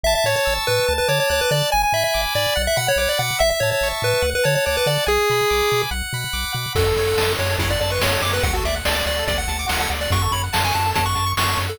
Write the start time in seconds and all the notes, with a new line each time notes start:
0.03 A1 E5 A5
0.15 E5
0.24 A2 C#5 C#6
0.36 C#5
0.45 A1 E6
0.67 A2 B4 A5
0.88 D2 A5
0.98 B4
1.08 D3 C#5 D6
1.20 C#5
1.29 D2 C#5 F#6
1.41 B4
1.50 D3 D5 A5
1.72 G#1 G#5
1.83 G#5
1.93 G#2 E5 B5
2.04 E5
2.14 G#1 D6
2.34 G#2 D5 G#5
2.56 B1 F#5
2.67 E5
2.76 B2 F#5 B5
2.88 C#5
2.96 B1 C#5 D6
3.09 D5
3.19 B2 F#5
3.39 A1 E5
3.50 E5
3.60 A2 C#5 A5
3.71 C#5
3.81 A1 C#6
4.02 A2 B4 E5
4.22 D2 F#5
4.35 B4
4.44 D3 C#5 A5
4.55 C#5
4.66 D2 C#5 D6
4.77 B4
4.86 D3 D5 F#5
5.06 B1 G#4 G#5
5.30 B2 B5
5.50 B1 D6
5.70 B2 G#5
5.91 B1 F#5
6.13 B2 B5
6.33 B1 D6
6.53 B2 F#5
6.75 F#2 F#4 A4, kick, crash
6.86 A4
6.97 F#2 C#5, closed hi-hat
7.07 F#5
7.17 F#2 A5, snare
7.28 C#6
7.39 F#2 F#4 C#5, closed hi-hat
7.50 A4
7.58 F#2 E4 C#5, kick, closed hi-hat
7.70 D5 F#5
7.81 F#2 D5 A5, closed hi-hat
7.90 B4 C#6
8.00 F#2 F#4 C#5, snare
8.12 A4
8.22 F#2 C#5 D6, open hi-hat
8.33 B4 F#5
8.43 D2 F#4 F#5, kick, closed hi-hat
8.54 F#4 A4
8.65 D2 D5 E5, closed hi-hat
8.75 F#5
8.85 D2 D5 A5, snare
8.95 D5 D6
9.06 D2 F#4 D5, closed hi-hat
9.19 A4
9.28 D2 D5, kick, closed hi-hat
9.38 F#5
9.48 D2 A5, closed hi-hat
9.59 D6
9.68 D2 F#4 F#5, snare
9.79 A4 F#5
9.90 D2 D5, closed hi-hat
10.01 D5 F#5
10.10 F#2 F#4 C#6, kick, closed hi-hat
10.22 A4 C#6
10.31 F#2 C#5 B5, closed hi-hat
10.44 F#5
10.53 F#2 A5, snare
10.64 G#5 C#6
10.74 F#2 F#4 A5, closed hi-hat
10.86 A4
10.94 F#2 C#5 A5, kick, closed hi-hat
11.05 F#5 C#6
11.15 F#2 A5, closed hi-hat
11.26 C#6
11.37 F#2 F#4 C#6, snare
11.48 A4 C#6
11.56 F#2 C#5, closed hi-hat
11.68 A4 F#5